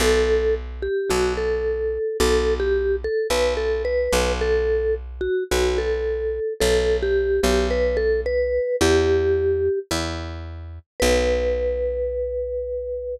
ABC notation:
X:1
M:4/4
L:1/16
Q:1/4=109
K:Bm
V:1 name="Vibraphone"
A4 z2 G2 F2 A6 | A3 G3 A2 B2 A2 B4 | A4 z2 F2 F2 A6 | A3 G3 G2 B2 A2 B4 |
G8 z8 | B16 |]
V:2 name="Electric Bass (finger)" clef=bass
B,,,8 B,,,8 | B,,,8 B,,,6 B,,,2- | B,,,8 B,,,8 | B,,,6 B,,,10 |
E,,8 E,,8 | B,,,16 |]